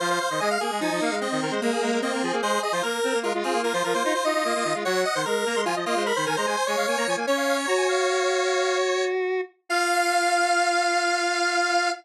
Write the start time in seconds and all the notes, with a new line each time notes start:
0.00 F3 C5 F5
0.10 C5 F5
0.20 C5 F5
0.30 D#3 C5 D#5
0.39 G#3 D#5 G#5
0.51 F5
0.61 A#3 G#4
0.71 G#3
0.80 F3 D#4 G#5
0.91 F3 D#5
1.01 A#3 F5
1.11 G#3
1.21 C4 D#5
1.31 D#3 D#5
1.41 D#3 A#4
1.51 G#3 C5
1.62 G#3 A#3 A#4
1.72 G#4
1.81 G#3 A#4
1.92 G#3 A#4
2.02 A#3 C4 D#5
2.12 A#3 A#4
2.22 F3 G#4
2.32 A#3 G#4
2.42 G#3 G#4 C5
2.53 G#4
2.63 G#4 D#5
2.72 F3 F4 C5
2.83 A#3 A#4
3.04 C4
3.14 A#3
3.23 G#3 F4 A#4
3.34 G#3 F4
3.43 C4 F4 G#4
3.53 A#3
3.64 F4 A#4
3.73 F3 F4 C5
3.84 F3 F4 A#4
3.94 A#3 F4 C5
4.03 D#4 F4 C5
4.14 F4 C5
4.24 D#4 F4 D#5
4.34 D#4 F4
4.44 A#3 F4
4.55 A#3 F4
4.64 D#3 F4
4.74 G#3 F4
4.85 F#3 C#5 F#5
5.05 D#5
5.15 D#3 C5
5.25 G#3 A#4
5.46 A#3 A#5
5.55 G#3 C6
5.65 F3 F4 G#5
5.76 F3 D#5
5.85 A#3 F4 D#5
5.96 G#3 C5
6.06 A#4 B5
6.16 D#3 C5
6.26 D#3 A#4 G#5
6.36 G#3 C5 A#5
6.46 G#3 C5 G#5
6.57 C5
6.67 G#3 C#5 G#5
6.77 G#3 F5
6.87 A#3 G#5
6.97 A#3 A#5
7.07 F3 G#5
7.16 A#3 G#5
7.27 C#4 C#5
7.37 F5
7.47 F5
7.67 F#4 A#5
7.77 G#5
7.88 F5
9.69 F4 F5